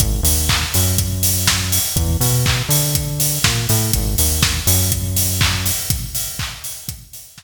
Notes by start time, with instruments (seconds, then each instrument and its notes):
0.00 synth bass 1 G#1, kick, closed hi-hat
0.23 synth bass 1 D#2, open hi-hat
0.49 kick, clap
0.74 synth bass 1 F#2, open hi-hat
0.98 kick, closed hi-hat
1.23 open hi-hat
1.47 kick, snare
1.72 open hi-hat
1.96 synth bass 1 E2, kick, closed hi-hat
2.20 synth bass 1 B2, open hi-hat
2.46 kick, clap
2.69 synth bass 1 D3, open hi-hat
2.95 kick, closed hi-hat
3.20 open hi-hat
3.44 synth bass 1 A#2, kick, snare
3.69 synth bass 1 A2, open hi-hat
3.93 synth bass 1 G#1, kick, closed hi-hat
4.18 synth bass 1 D#2, open hi-hat
4.43 kick, snare
4.67 synth bass 1 F#2, open hi-hat
4.92 kick, closed hi-hat
5.16 open hi-hat
5.41 kick, clap
5.66 open hi-hat
5.90 kick, closed hi-hat
6.15 open hi-hat
6.39 kick, clap
6.64 open hi-hat
6.88 kick, closed hi-hat
7.13 open hi-hat
7.38 kick, snare